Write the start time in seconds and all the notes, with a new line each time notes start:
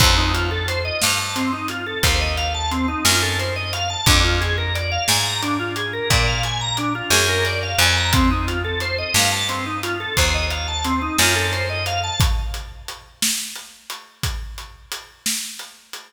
0.00 F2 C4, kick, crash
0.17 D#4
0.34 F4, closed hi-hat
0.51 A4
0.68 C5, closed hi-hat
0.85 D#5
1.02 G2 F5, snare
1.19 A5
1.36 C4, closed hi-hat
1.53 D#4
1.68 F4, closed hi-hat
1.86 A4
2.03 D#2 C5, kick, closed hi-hat
2.20 D#5
2.37 F5, closed hi-hat
2.54 A5
2.71 C4, closed hi-hat
2.88 D#4
3.05 F#2 F4, snare
3.22 A4
3.39 C5, closed hi-hat
3.56 D#5
3.73 F5, closed hi-hat
3.90 A5
4.06 F2 D4, kick, closed hi-hat
4.24 F4
4.41 G#4, closed hi-hat
4.58 A#4
4.75 D5, closed hi-hat
4.92 F5
5.08 G#2 G#5, snare
5.25 A#5
5.42 D4, closed hi-hat
5.59 F4
5.76 G#4, closed hi-hat
5.93 A#4
6.10 A#2 D5, kick, closed hi-hat
6.27 F5
6.43 G#5, closed hi-hat
6.61 A#5
6.77 D4, closed hi-hat
6.95 F4
7.10 F#2 G#4, snare
7.29 A#4
7.45 D5, closed hi-hat
7.63 F5
7.78 F2 G#5, closed hi-hat
7.97 A#5
8.13 C4, kick, closed hi-hat
8.31 D#4
8.47 F4, closed hi-hat
8.64 A4
8.80 C5, closed hi-hat
8.98 D#5
9.14 G2 F5, snare
9.32 A5
9.49 C4, closed hi-hat
9.66 D#4
9.83 F4, closed hi-hat
10.00 A4
10.17 D#2 C5, kick, closed hi-hat
10.34 D#5
10.51 F5, closed hi-hat
10.68 A5
10.84 C4, closed hi-hat
11.02 D#4
11.18 F#2 F4, snare
11.36 A4
11.53 C5, closed hi-hat
11.69 D#5
11.86 F5, closed hi-hat
12.03 A5
12.20 kick, closed hi-hat
12.54 closed hi-hat
12.88 closed hi-hat
13.22 snare
13.56 closed hi-hat
13.90 closed hi-hat
14.23 kick, closed hi-hat
14.58 closed hi-hat
14.92 closed hi-hat
15.26 snare
15.59 closed hi-hat
15.93 closed hi-hat